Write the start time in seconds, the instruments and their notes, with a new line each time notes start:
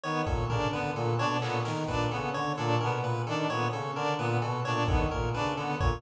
0.04 brass section D#3, clarinet B3, lead 1 (square) C#5
0.26 brass section A#2, lead 1 (square) A4, kick
0.50 brass section C#3, clarinet D4, lead 1 (square) A#4, floor tom
0.72 brass section D3, clarinet B3, lead 1 (square) B4
0.96 brass section A#2, lead 1 (square) A4
1.18 brass section B2, clarinet D4, lead 1 (square) C#5
1.41 brass section A#2, clarinet B3, lead 1 (square) A4, clap
1.65 brass section D#3, lead 1 (square) A#4, snare
1.88 brass section A#2, clarinet D4, lead 1 (square) B4, kick
2.11 brass section C#3, clarinet B3, lead 1 (square) A4
2.34 brass section D3, lead 1 (square) C#5
2.57 brass section A#2, clarinet D4, lead 1 (square) A4
2.81 brass section B2, clarinet B3, lead 1 (square) A#4
3.02 brass section A#2, lead 1 (square) B4
3.27 brass section D#3, clarinet D4, lead 1 (square) A4
3.49 brass section A#2, clarinet B3, lead 1 (square) C#5
3.73 brass section C#3, lead 1 (square) A4
3.95 brass section D3, clarinet D4, lead 1 (square) A#4
4.18 brass section A#2, clarinet B3, lead 1 (square) B4
4.42 brass section B2, lead 1 (square) A4, cowbell
4.65 brass section A#2, clarinet D4, lead 1 (square) C#5
4.88 brass section D#3, clarinet B3, lead 1 (square) A4, kick
5.11 brass section A#2, lead 1 (square) A#4, kick
5.33 brass section C#3, clarinet D4, lead 1 (square) B4
5.57 brass section D3, clarinet B3, lead 1 (square) A4
5.80 brass section A#2, lead 1 (square) C#5, kick